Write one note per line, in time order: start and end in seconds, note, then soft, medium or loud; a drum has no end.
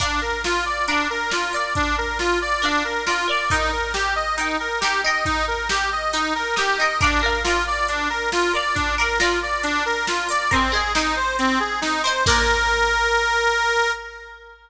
0.00 0.20 D4 medium
0.00 0.80 A#4 medium
0.00 0.80 D5 medium
0.00 0.80 F5 medium
0.00 kick medium
0.00 crash medium
0.21 0.42 A#4 medium
0.44 0.65 F4 medium
0.44 snare medium
0.66 0.86 D5 medium
0.88 1.08 D4 medium
0.88 1.29 A#4 medium
0.88 1.29 D5 medium
0.88 1.29 F5 medium
0.88 closed hi-hat medium
1.10 1.30 A#4 medium
1.30 1.52 F4 medium
1.30 1.50 A#4 medium
1.30 1.50 D5 medium
1.30 1.50 F5 medium
1.30 snare medium
1.53 2.54 A#4 medium
1.53 1.73 D5 medium
1.53 2.54 D5 medium
1.53 2.54 F5 medium
1.75 1.96 D4 medium
1.75 kick medium
1.75 closed hi-hat medium
1.98 2.18 A#4 medium
2.19 2.39 F4 medium
2.19 snare medium
2.42 2.62 D5 medium
2.62 2.83 D4 medium
2.62 3.02 A#4 medium
2.62 3.02 D5 medium
2.62 3.02 F5 medium
2.62 closed hi-hat medium
2.84 3.04 A#4 medium
3.06 3.26 F4 medium
3.06 3.27 A#4 medium
3.06 3.27 D5 medium
3.06 3.27 F5 medium
3.06 snare medium
3.28 3.48 A#4 medium
3.28 3.49 D5 medium
3.28 3.48 D5 medium
3.28 3.48 F5 medium
3.50 3.71 D#4 medium
3.50 4.32 D#4 medium
3.50 4.32 A#4 medium
3.50 kick medium
3.50 closed hi-hat medium
3.54 4.32 G5 medium
3.72 3.92 A#4 medium
3.94 4.14 G4 medium
3.94 snare medium
4.16 4.36 D#5 medium
4.37 4.57 D#4 medium
4.37 4.78 D#4 medium
4.37 4.78 A#4 medium
4.37 4.78 G5 medium
4.37 closed hi-hat medium
4.60 4.80 A#4 medium
4.81 5.03 D#4 medium
4.81 5.01 G4 medium
4.81 5.03 A#4 medium
4.81 snare loud
4.86 5.03 G5 medium
5.04 6.05 D#4 medium
5.04 6.05 A#4 medium
5.04 5.24 D#5 medium
5.04 6.05 G5 medium
5.25 5.45 D#4 medium
5.25 kick medium
5.25 closed hi-hat medium
5.47 5.68 A#4 medium
5.69 5.90 G4 medium
5.69 snare loud
5.92 6.12 D#5 medium
6.13 6.33 D#4 medium
6.13 6.54 D#4 medium
6.13 6.54 A#4 medium
6.13 6.54 G5 medium
6.13 closed hi-hat medium
6.35 6.55 A#4 medium
6.56 6.76 D#4 medium
6.56 6.78 G4 medium
6.56 6.76 A#4 medium
6.56 6.76 G5 medium
6.56 snare medium
6.78 7.00 D#4 medium
6.78 7.00 A#4 medium
6.78 6.98 D#5 medium
6.83 7.00 G5 medium
7.01 7.21 D4 medium
7.01 7.21 A#4 medium
7.01 7.21 D5 medium
7.01 7.21 F5 medium
7.01 kick loud
7.01 closed hi-hat medium
7.22 7.42 A#4 medium
7.22 7.43 A#4 medium
7.22 7.43 D5 medium
7.22 7.43 F5 medium
7.44 7.64 F4 medium
7.44 8.46 A#4 medium
7.44 8.46 D5 medium
7.44 8.46 F5 medium
7.44 snare medium
7.67 7.87 D5 medium
7.88 8.09 D4 medium
7.88 closed hi-hat medium
8.10 8.30 A#4 medium
8.32 8.52 F4 medium
8.32 snare medium
8.53 8.94 A#4 medium
8.53 8.94 D5 medium
8.53 8.75 D5 medium
8.53 8.94 F5 medium
8.75 8.95 D4 medium
8.75 kick medium
8.75 closed hi-hat medium
8.98 9.18 A#4 medium
8.98 9.18 D5 medium
8.98 9.18 F5 medium
9.19 9.39 F4 medium
9.19 10.21 A#4 medium
9.19 10.21 D5 medium
9.19 snare loud
9.23 10.21 F5 medium
9.42 9.63 D5 medium
9.63 9.83 D4 medium
9.63 closed hi-hat medium
9.86 10.06 A#4 medium
10.07 10.28 F4 medium
10.07 snare loud
10.29 10.49 A#4 medium
10.29 10.50 D5 medium
10.29 10.49 D5 medium
10.29 10.49 F5 medium
10.51 10.72 C4 medium
10.51 10.71 A#4 medium
10.51 10.71 C5 medium
10.51 10.71 D#5 medium
10.51 kick medium
10.51 closed hi-hat medium
10.56 10.71 G#5 medium
10.72 10.92 G#4 medium
10.72 10.92 A#4 medium
10.72 10.92 C5 medium
10.72 10.92 D#5 medium
10.77 10.92 G#5 medium
10.95 11.15 D#4 medium
10.95 11.96 A#4 medium
10.95 11.96 C5 medium
10.95 11.96 D#5 medium
10.95 snare loud
10.99 11.96 G#5 medium
11.16 11.36 C5 medium
11.39 11.59 C4 medium
11.39 closed hi-hat medium
11.60 11.80 G#4 medium
11.81 12.02 D#4 medium
11.81 snare medium
12.03 12.24 A#4 medium
12.03 12.23 C5 medium
12.03 12.24 C5 medium
12.03 12.24 D#5 medium
12.09 12.24 G#5 medium
12.26 13.91 A#3 loud
12.26 13.91 D4 loud
12.26 13.91 F4 loud
12.26 13.91 A#4 loud
12.26 kick loud
12.26 crash loud